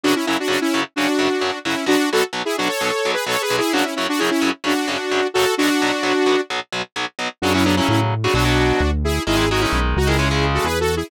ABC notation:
X:1
M:4/4
L:1/16
Q:1/4=130
K:F#m
V:1 name="Lead 2 (sawtooth)"
[DF] [CE] [CE] [DF] [DF] [CE]2 z [DF]6 [CE]2 | [DF]2 [FA] z2 [EG] [DF] [Ac]4 [GB] (3[Ac]2 [GB]2 [EG]2 | [DF] [CE] [CE] [DF] [EG] [CE]2 z [DF]6 [FA]2 | [DF]8 z8 |
[DF] [CE] [B,D] [CE] [CE] z2 [DF] [DF]6 [EG]2 | [EG]2 [^DF] [CE]2 z [DF] [EG]4 [FA] (3[GB]2 [FA]2 [EG]2 |]
V:2 name="Overdriven Guitar" clef=bass
[F,,C,F,]2 [F,,C,F,]2 [F,,C,F,]2 [F,,C,F,]2 [F,,C,F,]2 [F,,C,F,]2 [F,,C,F,]2 [F,,C,F,]2 | [B,,,B,,F,]2 [B,,,B,,F,]2 [B,,,B,,F,]2 [B,,,B,,F,]2 [B,,,B,,F,]2 [B,,,B,,F,]2 [B,,,B,,F,]2 [B,,,B,,F,]2 | [F,,C,F,]2 [F,,C,F,]2 [F,,C,F,]2 [F,,C,F,]2 [F,,C,F,]2 [F,,C,F,]2 [F,,C,F,]2 [F,,C,F,]2 | [B,,,B,,F,]2 [B,,,B,,F,]2 [B,,,B,,F,]2 [B,,,B,,F,]2 [B,,,B,,F,]2 [B,,,B,,F,]2 [B,,,B,,F,]2 [B,,,B,,F,]2 |
[C,F,] [C,F,] [C,F,] [C,F,]4 [C,F,] [B,,F,] [B,,F,]7 | [^D,G,] [D,G,] [D,G,] [D,G,]4 [D,G,] [C,G,] [C,G,]7 |]
V:3 name="Synth Bass 1" clef=bass
z16 | z16 | z16 | z16 |
F,,4 A,,4 B,,,4 D,,4 | G,,,4 B,,,2 C,,6 E,,4 |]